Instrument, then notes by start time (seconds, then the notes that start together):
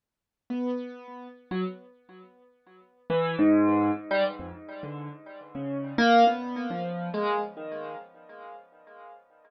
acoustic grand piano
0.50 B3
1.51 F#3
3.10 E3
3.39 G#2
4.11 G3
4.39 F2
4.83 D3
5.55 C#3
5.98 A#3
6.27 B3
6.70 F3
7.14 G#3
7.57 D#3